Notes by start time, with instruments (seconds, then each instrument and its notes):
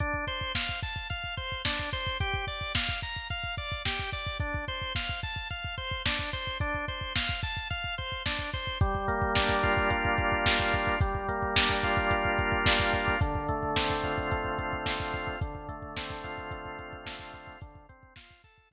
0.00 drawbar organ D4, kick, closed hi-hat
0.14 kick
0.27 drawbar organ C5, kick, closed hi-hat
0.41 kick
0.55 drawbar organ F5, kick, snare
0.69 kick
0.82 drawbar organ A5, kick, closed hi-hat
0.96 kick
1.10 drawbar organ F5, kick, closed hi-hat
1.24 kick
1.37 drawbar organ C5, kick, closed hi-hat
1.52 kick
1.65 drawbar organ D4, kick, snare
1.79 kick
1.93 drawbar organ C5, kick, closed hi-hat
2.07 kick
2.20 drawbar organ G4, kick, closed hi-hat
2.34 kick
2.47 drawbar organ D5, kick, closed hi-hat
2.61 kick
2.75 drawbar organ F5, kick, snare
2.89 kick
3.02 drawbar organ A#5, kick, closed hi-hat
3.16 kick
3.30 drawbar organ F5, kick, closed hi-hat
3.44 kick
3.57 drawbar organ D5, kick, closed hi-hat
3.72 kick
3.85 drawbar organ G4, kick, snare
3.99 kick
4.13 drawbar organ D5, kick, closed hi-hat
4.27 kick
4.40 drawbar organ D4, kick, closed hi-hat
4.54 kick
4.68 drawbar organ C5, kick, closed hi-hat
4.82 kick
4.95 drawbar organ F5, kick, snare
5.09 kick
5.23 drawbar organ A5, kick, closed hi-hat
5.36 kick
5.50 drawbar organ F5, kick, closed hi-hat
5.64 kick
5.78 drawbar organ C5, kick, closed hi-hat
5.91 kick
6.06 drawbar organ D4, kick, snare
6.19 kick
6.33 drawbar organ C5, kick, closed hi-hat
6.47 kick
6.60 drawbar organ D4, kick, closed hi-hat
6.74 kick
6.88 drawbar organ C5, kick, closed hi-hat
7.01 kick
7.15 drawbar organ F5, kick, snare
7.29 kick
7.43 drawbar organ A5, kick, closed hi-hat
7.57 kick
7.70 drawbar organ F5, kick, closed hi-hat
7.84 kick
7.98 drawbar organ C5, kick, closed hi-hat
8.12 kick
8.26 drawbar organ D4, kick, snare
8.39 kick
8.54 drawbar organ C5, kick, closed hi-hat
8.67 kick
8.81 drawbar organ G3, kick, closed hi-hat
8.95 kick
9.08 drawbar organ A#3, kick, closed hi-hat
9.22 kick
9.35 drawbar organ D4, kick, snare
9.49 kick
9.63 drawbar organ F4, kick, closed hi-hat
9.77 kick
9.90 drawbar organ G3, kick, closed hi-hat
10.05 kick
10.18 drawbar organ A#3, kick, closed hi-hat
10.32 kick
10.46 drawbar organ D4, kick, snare
10.60 kick
10.73 drawbar organ F4, kick, closed hi-hat
10.87 kick
11.01 drawbar organ G3, kick, closed hi-hat
11.15 kick
11.28 drawbar organ A#3, kick, closed hi-hat
11.43 kick
11.56 drawbar organ D4, kick, snare
11.70 kick
11.83 drawbar organ F4, kick, closed hi-hat
11.97 kick
12.11 drawbar organ G3, kick, closed hi-hat
12.25 kick
12.38 drawbar organ A#3, kick, closed hi-hat
12.52 kick
12.66 drawbar organ D4, kick, snare
12.80 kick
12.93 drawbar organ F4, kick, open hi-hat
13.08 kick
13.21 drawbar organ D3, kick, closed hi-hat
13.35 kick
13.48 drawbar organ A3, kick, closed hi-hat
13.63 kick
13.76 drawbar organ C4, kick, snare
13.90 kick
14.04 drawbar organ F4, kick, closed hi-hat
14.18 kick
14.31 drawbar organ D3, kick, closed hi-hat
14.45 kick
14.58 drawbar organ A3, kick, closed hi-hat
14.73 kick
14.86 drawbar organ C4, kick, snare
15.00 kick
15.13 drawbar organ F4, kick, closed hi-hat
15.27 kick
15.41 drawbar organ D3, kick, closed hi-hat
15.55 kick
15.68 drawbar organ A3, kick, closed hi-hat
15.82 kick
15.96 drawbar organ C4, kick, snare
16.10 kick
16.24 drawbar organ F4, kick, closed hi-hat
16.38 kick
16.51 drawbar organ D3, kick, closed hi-hat
16.65 kick
16.79 drawbar organ A3, kick, closed hi-hat
16.93 kick
17.06 drawbar organ C4, kick, snare
17.19 kick
17.34 drawbar organ F4, kick, closed hi-hat
17.47 kick
17.61 drawbar organ D3, kick, closed hi-hat
17.75 kick
17.89 drawbar organ C4, kick, closed hi-hat
18.03 kick
18.16 drawbar organ F4, kick, snare
18.31 kick
18.44 drawbar organ A4, kick, closed hi-hat
18.58 kick
18.71 drawbar organ F4, kick, closed hi-hat